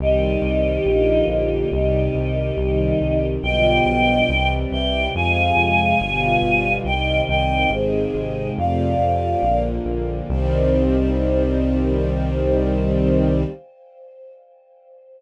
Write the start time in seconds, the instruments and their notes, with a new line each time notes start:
0.00 synth bass 1 C2, string ensemble 1 D#3 G3 C4, choir aahs D#4 G4
0.42 synth bass 1 C2
0.86 synth bass 1 A#1, string ensemble 1 D3 F3 A#3
1.28 synth bass 1 A#1, choir aahs D#4 G4
1.71 synth bass 1 C2, string ensemble 1 C3 D#3 G3, choir aahs D#4 G4
2.15 synth bass 1 C2
2.57 synth bass 1 C2, string ensemble 1 C3 D#3 G3
3.01 synth bass 1 C2
3.43 synth bass 1 B1, string ensemble 1 B2 D3 F3 G3, choir aahs D#5 G5
3.86 synth bass 1 B1
4.28 synth bass 1 C2, string ensemble 1 C3 E3 G3
4.71 synth bass 1 C2, choir aahs E5 G5
5.14 synth bass 1 F2, string ensemble 1 C3 F3 G#3, choir aahs F5 G#5
5.57 synth bass 1 F2
6.00 synth bass 1 G1, string ensemble 1 B2 D3 F3 G3
6.43 synth bass 1 G1
6.84 synth bass 1 C2, string ensemble 1 C3 D#3 G3, choir aahs D#5 G5
7.29 synth bass 1 C2, choir aahs D#5 G5
7.71 synth bass 1 G#1, string ensemble 1 C3 D#3 G#3, choir aahs G#4 C5
8.15 synth bass 1 G#1
8.57 synth bass 1 F2, string ensemble 1 C3 F3 A3, choir aahs D5 F5
8.99 synth bass 1 F2
9.42 synth bass 1 A#1, string ensemble 1 D3 F3 A#3
9.85 synth bass 1 A#1
10.29 synth bass 1 C2, string ensemble 1 D#3 G3 C4, choir aahs C5